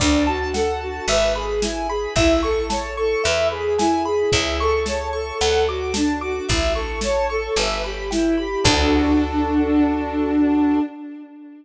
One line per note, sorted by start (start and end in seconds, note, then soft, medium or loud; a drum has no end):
0.00 1.00 D2 medium
0.00 0.24 D4 medium
0.00 0.24 D5 loud
0.00 kick medium
0.00 crash medium
0.27 0.52 F#4 medium
0.27 0.51 A5 medium
0.54 0.79 A4 medium
0.54 0.78 F#5 medium
0.54 snare medium
0.81 1.06 F#4 medium
0.81 1.05 A5 medium
1.08 2.07 G#1 medium
1.08 1.33 B4 medium
1.08 1.33 E5 loud
1.08 closed hi-hat loud
1.35 1.60 G#4 medium
1.35 1.60 B5 medium
1.62 1.87 E4 medium
1.62 1.87 G#5 medium
1.62 snare loud
1.89 2.13 G#4 medium
1.89 2.14 B5 medium
2.16 3.15 A1 medium
2.16 2.41 E4 medium
2.16 2.41 E5 loud
2.16 kick medium
2.16 closed hi-hat medium
2.43 2.67 A4 medium
2.43 2.67 C#6 medium
2.70 2.95 C#5 medium
2.70 2.94 A5 medium
2.70 snare medium
2.97 3.22 A4 medium
2.97 3.22 C#6 medium
3.24 4.25 E2 medium
3.24 3.49 B4 medium
3.24 3.48 E5 loud
3.24 closed hi-hat medium
3.51 3.76 G#4 medium
3.51 3.76 B5 medium
3.79 4.03 E4 medium
3.79 4.03 G#5 medium
3.79 snare loud
4.05 4.30 G#4 medium
4.05 4.30 B5 medium
4.32 5.32 C#2 medium
4.32 4.57 E4 medium
4.32 4.57 E5 loud
4.32 kick medium
4.32 closed hi-hat medium
4.60 4.85 A4 medium
4.60 4.85 C#6 medium
4.85 5.12 C#5 medium
4.85 5.10 A5 medium
4.85 snare medium
5.13 5.38 A4 medium
5.13 5.37 C#6 medium
5.40 6.41 D2 medium
5.40 5.65 A4 medium
5.40 5.66 F#5 loud
5.40 closed hi-hat medium
5.67 5.92 F#4 medium
5.67 5.93 D6 medium
5.94 6.20 D4 medium
5.94 6.18 A5 medium
5.94 snare loud
6.21 6.47 F#4 medium
6.21 6.46 D6 medium
6.49 7.49 A1 medium
6.49 6.74 E4 medium
6.49 6.73 E5 loud
6.49 kick medium
6.49 closed hi-hat medium
6.75 7.00 A4 medium
6.75 7.00 C#6 medium
7.01 7.28 C#5 medium
7.01 7.26 A5 medium
7.01 snare medium
7.30 7.55 A4 medium
7.30 7.54 C#6 medium
7.56 8.56 G1 medium
7.56 7.81 B4 medium
7.56 7.81 E5 medium
7.56 closed hi-hat medium
7.84 8.10 G4 medium
7.84 8.08 B5 medium
8.10 8.35 E4 medium
8.10 8.35 G5 medium
8.10 snare medium
8.38 8.64 G4 medium
8.38 8.62 B5 medium
8.64 10.80 D2 loud
8.64 10.79 D4 loud
8.64 10.79 F#4 loud
8.64 10.79 A4 loud
8.64 kick loud
8.64 crash loud